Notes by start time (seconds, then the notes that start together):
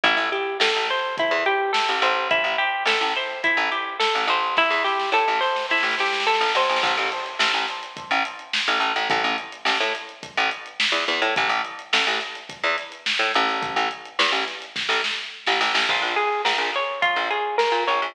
0.04 A1 E4, kick, closed hi-hat
0.17 A1
0.32 G4, closed hi-hat
0.60 A1 A4, snare
0.76 A1
0.89 C5, snare, closed hi-hat
1.17 E4, kick, closed hi-hat
1.31 E2
1.46 G4, closed hi-hat
1.73 A4, snare
1.89 A1
2.02 A1 C5, closed hi-hat
2.31 E4, kick, closed hi-hat
2.44 A1
2.58 G4, closed hi-hat
2.85 A1 A4, snare
3.01 A1
3.16 C5, closed hi-hat
3.30 snare
3.44 E4, kick, closed hi-hat
3.57 A1
3.71 G4, closed hi-hat
3.99 A4, snare
4.15 A1, snare
4.27 A1 C5, closed hi-hat
4.43 snare
4.57 E4, kick, snare
4.70 E2, snare
4.84 G4, snare
5.00 snare
5.12 A2 A4, snare
5.28 A1, snare
5.40 C5, snare
5.56 snare
5.70 E4, snare
5.78 snare
5.83 A1, snare
5.91 snare
5.99 G4, snare
6.06 snare
6.13 snare
6.20 snare
6.26 A4, snare
6.34 snare
6.41 A1, snare
6.48 snare
6.55 A1 C5, snare
6.62 snare
6.69 A1, snare
6.76 snare
6.83 A1, kick, crash
6.97 A1, closed hi-hat
7.12 snare, closed hi-hat
7.26 closed hi-hat
7.39 A1, snare
7.53 A1, closed hi-hat
7.68 snare, closed hi-hat
7.83 closed hi-hat
7.97 kick, closed hi-hat
8.11 A1, closed hi-hat
8.25 closed hi-hat
8.39 closed hi-hat
8.53 snare
8.68 A1, closed hi-hat
8.80 A1, closed hi-hat
8.96 A1, snare, closed hi-hat
9.10 A1, kick, closed hi-hat
9.24 A1, snare, closed hi-hat
9.38 closed hi-hat
9.52 closed hi-hat
9.65 A1, snare
9.80 A2, closed hi-hat
9.95 closed hi-hat
10.09 closed hi-hat
10.23 kick, closed hi-hat
10.37 A1, closed hi-hat
10.51 closed hi-hat
10.66 closed hi-hat
10.80 snare
10.92 E2, closed hi-hat
11.08 E2, closed hi-hat
11.22 A2, closed hi-hat
11.36 A1, kick, closed hi-hat
11.49 A1, closed hi-hat
11.65 closed hi-hat
11.79 closed hi-hat
11.93 A1, snare
12.07 A1, closed hi-hat
12.21 closed hi-hat
12.35 closed hi-hat
12.49 kick, closed hi-hat
12.64 E2, closed hi-hat
12.78 snare, closed hi-hat
12.92 closed hi-hat
13.06 snare
13.19 A2, closed hi-hat
13.34 A1, snare, closed hi-hat
13.49 open hi-hat
13.63 kick, closed hi-hat
13.76 A1, closed hi-hat
13.91 closed hi-hat
14.05 closed hi-hat
14.19 E2, snare
14.32 A1, closed hi-hat
14.48 snare, closed hi-hat
14.62 closed hi-hat
14.76 kick, snare
14.89 A1, snare
15.04 snare
15.47 A1, snare
15.61 A1, snare
15.74 A1, snare
15.89 A#1 F4, kick, crash
16.02 A#1
16.16 G#4, closed hi-hat
16.32 snare
16.45 A#1 A#4, snare
16.58 A#1, snare
16.74 C#5, closed hi-hat
17.02 F4, kick, closed hi-hat
17.16 A#1
17.30 G#4, closed hi-hat
17.58 A#4, snare
17.72 A#2
17.87 A#1 C#5, closed hi-hat
18.02 A#1